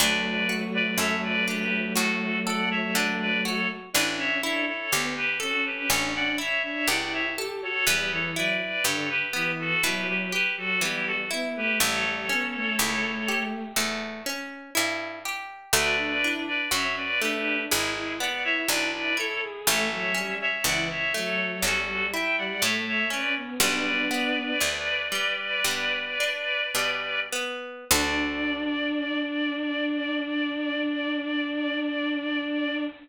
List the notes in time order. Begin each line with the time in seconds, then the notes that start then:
0.00 D2 F#3 A3 D4 B4 D5
0.49 F#4
0.74 B4 D5
0.98 F#2 A4 C#5 E5
1.23 B4 D5
1.48 D4 G4 B4
1.95 A2 F#4 A4
2.46 A4 D5 F#5
2.71 C#5 E5
2.95 D3 D4 B4 D5
3.20 B4 D5
3.45 F#4 A4 C#5
3.93 A1 D4 E4 B4 D5
4.16 C#4 C#5 E5
4.42 D4 E4 A4 C#5
4.67 A4 C#5
4.92 D2 B3 G4
5.16 G4 B4
5.40 C#4 F#4 A4
5.66 G4 B4
5.89 A1 C#4 D4 A4 C#5
6.15 D4 D5 F#5
6.38 E4 C#5 E5
6.63 D4 C#5 E5
6.88 C#2 E4 G4 D5 F#5
7.13 C#5 E5
7.36 G4 A4
7.62 F#4 A4 C#5
7.87 E2 G3 B3 G4 B4
8.11 E3 A4 C#5
8.36 F#3 E4 B4 D5
8.84 G2 D3 G4 A4 C#5
9.10 G4 B4
9.33 E3 B3
9.59 F#4 A4
9.83 B2 F#3 E4 G4 B4
10.08 F#3 G4 B4
10.32 G4 B4
10.57 F#3 F#4 A4
10.81 E3 G3 B3 E4 G4
11.07 F#4 A4
11.31 B3 E4
11.56 A3 G4 B4
11.80 A1 G3 A3 A4 C#5
12.04 G3
12.29 B3 C#4
12.55 A3
12.78 C#2 A3 E4
13.28 G4
13.76 E2 A3
14.26 C#4
14.75 G2 E4
15.25 G4
15.73 D2 A3 F#4 B4 D5
15.97 D4
16.22 D4 E4
16.48 B4 D5
16.71 F#2 C#4 F#4 C#5 E5
16.97 B4 D5
17.20 A3 D4 G4 B4
17.69 G#1 G#3 E4 G#4
17.96 E4
18.20 B3 D5 F#5
18.44 E4 C#5 E5
18.68 B1 D4 E4 B4 D5
18.93 B4 D5
19.17 E4 A4 C#5
19.42 G#4
19.66 A1 A3 C#5 E5
19.92 F#3
20.15 G3 C#4
20.41 C#5 E5
20.64 C#2 E3 E4 D5 F#5
20.90 C#5 E5
21.14 F#3 A3 A4 C#5
21.63 E2 G3 C#4 F#4 A4
21.88 G3
22.13 E4 E5 G5
22.38 G3 D5 F#5
22.61 A2 A3 C#5 E5
22.87 C#5 E5
23.10 C#4 B4 D5
23.37 B3
23.60 B1 G3 B3 D4 B4 D5
24.11 B3
24.60 D2 D4
25.12 G3
25.64 G2 B3
26.20 D4
26.75 B2 G3
27.33 B3
27.90 D2 D4 F#4 A4 D5